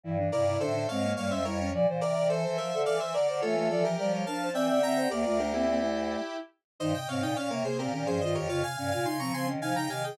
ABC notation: X:1
M:6/8
L:1/16
Q:3/8=71
K:F
V:1 name="Lead 1 (square)"
z2 [Bd]2 [Ac]2 [_df]2 [df] [ce] [Bd]2 | z2 [Bd]2 [Ac]2 [ce]2 [df] [ce] [Bd]2 | [FA]2 [FA] [GB] [GB]2 [fa]2 [eg] [eg] [gb]2 | [Bd]2 [GB] [EG]7 z2 |
[K:Fm] [ce] [eg] [df] [eg] [df] [Bd] [Ac] [GB] [GB] [Ac] [ce] [Bd] | [df] [fa] [fa] [fa] [ac'] [bd'] [ac'] z [fa] [gb] [fa] [eg] |]
V:2 name="Violin"
E D E E D D C B, B, _D E D | d c d d c c B A A c d c | ^c c d z d c B =c d d e c | G F D B, C E5 z2 |
[K:Fm] E z C E D B, B, C D D F G | F z D F E C C D E E G A |]
V:3 name="Flute"
E, E, C, C, D, D, _A,2 G,2 G,2 | F, E,5 z6 | A, A, F, F, G, G, D2 C2 C2 | B, A, A, C B, A,3 z4 |
[K:Fm] E, C, C, C, z C, C,2 E, F, E,2 | D, C, C, C, z C, D,2 C, D, C,2 |]
V:4 name="Choir Aahs" clef=bass
G,,2 G,,2 A,,2 _A,,2 G,, F,, F,,2 | B,, B,, C, C, E, E, F, D, E, E, D, D, | E,2 E,2 F,2 F,2 E, D, D,2 | D,, D,,7 z4 |
[K:Fm] G,, z A,, B,, B,, C, z B,, B,, G,, G,, F,, | F,, z G,, B,, D, F, F, E, F, D, E, E, |]